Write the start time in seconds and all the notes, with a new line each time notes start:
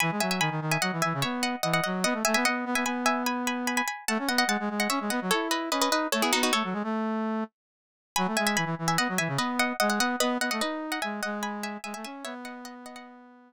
0.00 E3 G#5 B5
0.11 G#3
0.20 F#3 E5 G#5
0.31 E5 G#5
0.40 D#3 G#5 B5
0.51 D#3
0.61 D#3
0.71 E5 G#5
0.82 F#3 D#5 F#5
0.92 E3
1.02 E3 E5 G#5
1.14 C#3
1.22 B3 C#5 E5
1.43 D#5 F#5
1.63 E3 D#5 F#5
1.73 D#5 F#5
1.84 F#3 D#5 F#5
2.04 B3 D#5 F#5
2.13 A3
2.25 A3 E5 G#5
2.34 B3 E5 G#5
2.45 B3 D#5 F#5
2.65 B3
2.75 B3 E5 G#5
2.85 B3 G#5 B5
3.06 E5 G#5
3.26 G#5 B5
3.47 G#5 B5
3.67 G#5 B5
3.77 G#5 B5
3.88 G#5 B5
4.08 A3 F#5 A5
4.19 C#4
4.28 B3 D#5 F#5
4.38 D#5 F#5
4.47 G#3 F#5 A5
4.60 G#3
4.70 G#3
4.80 D#5 F#5
4.90 C#4 C#5 E5
5.01 G#3
5.10 B3 D#5 F#5
5.22 F#3
5.31 E4 A4 C#5
5.51 B4 D#5
5.71 C#4 B4 D#5
5.81 B4 D#5
5.90 D#4 B4 D#5
6.12 A3 A4 C#5
6.22 B3 E4 G#4
6.33 B3 D#4 F#4
6.43 D#4 F#4
6.53 A3 A4 C#5
6.64 F#3
6.73 G#3
6.84 A3
8.16 F#3 G#5 B5
8.27 A3
8.37 G#3 E5 G#5
8.47 E5 G#5
8.56 E3 G#5 B5
8.65 E3
8.79 E3
8.88 E5 G#5
8.98 B3 D#5 F#5
9.09 F#3
9.18 E3 E5 G#5
9.28 C#3
9.37 B3 B4 D#5
9.59 D#5 F#5
9.80 G#3 D#5 F#5
9.90 D#5 F#5
9.98 B3 D#5 F#5
10.20 B3 B4 D#5
10.40 B3 D#5 F#5
10.51 A3 D#5 F#5
10.61 D#4 B4 D#5
10.92 D#5 F#5
11.02 G#3 E5 G#5
11.23 G#3 D#5 F#5
11.43 G#5 B5
11.63 E5 G#5
11.84 G#3 E5 G#5
11.94 A3 E5 G#5
12.05 C#4 E5 G#5
12.24 B3 C#5 E5
12.45 D#5 F#5
12.65 D#5 F#5
12.86 D#5 F#5
12.96 D#5 F#5